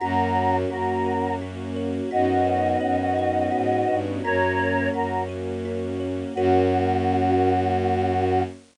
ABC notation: X:1
M:3/4
L:1/8
Q:1/4=85
K:F#mix
V:1 name="Choir Aahs"
[fa]2 [FA]2 z2 | [df]6 | [Ac]2 [FA] z3 | F6 |]
V:2 name="Kalimba"
F c F A F c | F B c d F B | F c F A F c | [FAc]6 |]
V:3 name="Violin" clef=bass
F,,2 F,,4 | F,,2 F,,2 G,, =G,, | F,,2 F,,4 | F,,6 |]
V:4 name="String Ensemble 1"
[A,CF]6 | [B,CDF]6 | [A,CF]6 | [A,CF]6 |]